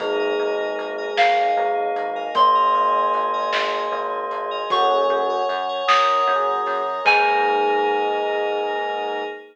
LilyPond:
<<
  \new Staff \with { instrumentName = "Electric Piano 2" } { \time 6/8 \key aes \mixolydian \tempo 4. = 51 r4. f''4. | c'''2. | des'''4. ees'''4. | aes''2. | }
  \new Staff \with { instrumentName = "Tubular Bells" } { \time 6/8 \key aes \mixolydian <aes, aes>2 <aes, aes>4 | <bes, bes>2 <bes, bes>4 | <ges, ges>4 r2 | aes2. | }
  \new Staff \with { instrumentName = "Electric Piano 1" } { \time 6/8 \key aes \mixolydian <bes ees' aes'>2.~ | <bes ees' aes'>2. | <bes des' ges' aes'>2 <bes des' ges' aes'>4 | <bes ees' aes'>2. | }
  \new Staff \with { instrumentName = "Electric Piano 2" } { \time 6/8 \key aes \mixolydian <bes' ees'' aes''>16 <bes' ees'' aes''>16 <bes' ees'' aes''>8. <bes' ees'' aes''>4. <bes' ees'' aes''>16~ | <bes' ees'' aes''>16 <bes' ees'' aes''>16 <bes' ees'' aes''>8. <bes' ees'' aes''>4. <bes' ees'' aes''>16 | <bes' des'' ges'' aes''>16 <bes' des'' ges'' aes''>8 <bes' des'' ges'' aes''>16 <bes' des'' ges'' aes''>16 <bes' des'' ges'' aes''>4.~ <bes' des'' ges'' aes''>16 | <bes' ees'' aes''>2. | }
  \new Staff \with { instrumentName = "Synth Bass 1" } { \clef bass \time 6/8 \key aes \mixolydian aes,,8 aes,,8 aes,,8 aes,,8 aes,,8 aes,,8 | aes,,8 aes,,8 aes,,8 aes,,8 aes,,8 aes,,8 | ges,8 ges,8 ges,8 ges,8 ges,8 ges,8 | aes,2. | }
  \new Staff \with { instrumentName = "Pad 5 (bowed)" } { \time 6/8 \key aes \mixolydian <bes ees' aes'>2. | <aes bes aes'>2. | <bes' des'' ges'' aes''>4. <bes' des'' aes'' bes''>4. | <bes ees' aes'>2. | }
  \new DrumStaff \with { instrumentName = "Drums" } \drummode { \time 6/8 <hh bd>4 hh8 sn4 hh8 | \tuplet 3/2 { <hh bd>16 r16 r16 r16 r16 r16 hh16 r16 hh16 } sn4 hh8 | <hh bd>4 hh8 sn4 hho8 | <cymc bd>4. r4. | }
>>